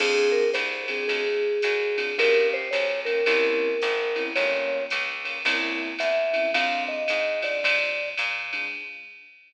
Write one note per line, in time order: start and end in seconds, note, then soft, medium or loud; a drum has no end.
0.00 0.51 F2 medium
0.00 0.42 C4 medium
0.00 0.42 D4 medium
0.00 0.42 F4 medium
0.00 0.27 G#4 loud
0.00 0.42 G#4 medium
0.00 kick medium
0.00 crash loud
0.00 ride medium
0.32 0.49 A#4 loud
0.54 1.05 C2 medium
0.54 0.84 C5 loud
0.54 hi-hat pedal medium
0.54 ride medium
0.88 1.23 C4 medium
0.88 1.23 D4 medium
0.88 1.23 F4 medium
0.88 1.23 G#4 medium
0.88 1.07 G#4 loud
0.88 ride medium
1.08 1.59 D2 medium
1.08 2.01 G#4 loud
1.08 kick soft
1.08 ride medium
1.62 2.14 F#2 medium
1.62 hi-hat pedal medium
1.62 ride medium
1.98 2.12 C4 medium
1.98 2.12 D4 medium
1.98 2.12 F4 medium
1.98 2.12 G#4 medium
1.98 ride medium
2.18 2.69 G1 medium
2.18 2.60 A#3 medium
2.18 2.60 C#4 medium
2.18 2.60 F4 medium
2.18 2.60 G4 medium
2.18 2.48 A#4 loud
2.18 kick medium
2.18 ride medium
2.54 2.73 C5 loud
2.71 3.23 B1 medium
2.71 3.00 C#5 loud
2.71 hi-hat pedal medium
2.71 ride medium
3.05 3.21 A#3 medium
3.05 3.21 C#4 medium
3.05 3.21 F4 medium
3.05 3.21 G4 medium
3.05 3.25 A#4 loud
3.05 ride medium
3.26 3.77 C2 medium
3.26 3.69 A#3 medium
3.26 3.69 C4 medium
3.26 3.69 C#4 medium
3.26 3.69 E4 medium
3.26 4.23 A#4 loud
3.26 kick soft
3.26 ride medium
3.82 4.33 G#1 medium
3.82 hi-hat pedal medium
3.82 ride medium
4.16 4.30 A#3 medium
4.16 4.30 C4 medium
4.16 4.30 C#4 medium
4.16 4.30 E4 medium
4.16 ride medium
4.35 4.87 G1 medium
4.35 4.79 G3 medium
4.35 4.79 A#3 medium
4.35 4.79 C#4 medium
4.35 4.79 F4 medium
4.35 4.84 C#5 loud
4.35 kick medium
4.35 ride medium
4.90 5.42 C#2 medium
4.90 hi-hat pedal medium
4.90 ride medium
5.25 5.39 G3 medium
5.25 5.39 A#3 medium
5.25 5.39 C#4 medium
5.25 5.39 F4 medium
5.25 ride medium
5.45 5.95 C2 medium
5.45 5.88 A#3 medium
5.45 5.88 C4 medium
5.45 5.88 C#4 medium
5.45 5.88 E4 medium
5.45 kick soft
5.45 ride medium
5.99 6.50 E2 medium
5.99 6.51 E5 loud
5.99 hi-hat pedal medium
5.99 ride medium
6.33 6.48 A#3 medium
6.33 6.48 C4 medium
6.33 6.48 C#4 medium
6.33 6.48 E4 medium
6.33 ride medium
6.53 7.05 F2 medium
6.53 6.96 G#3 medium
6.53 6.96 C4 medium
6.53 6.96 D4 medium
6.53 6.96 F4 medium
6.53 6.84 F5 loud
6.53 kick medium
6.53 ride medium
6.88 7.40 D#5 loud
7.08 7.60 G#2 medium
7.08 hi-hat pedal medium
7.08 ride medium
7.42 7.77 G#3 medium
7.42 7.77 C4 medium
7.42 7.77 D4 medium
7.42 7.77 F4 medium
7.42 8.09 D5 loud
7.42 ride medium
7.64 8.14 C3 medium
7.64 kick medium
7.64 ride loud
8.18 8.69 A#2 medium
8.18 hi-hat pedal medium
8.18 ride medium
8.53 8.67 G#3 medium
8.53 8.67 C4 medium
8.53 8.67 D4 medium
8.53 8.67 F4 medium
8.53 ride medium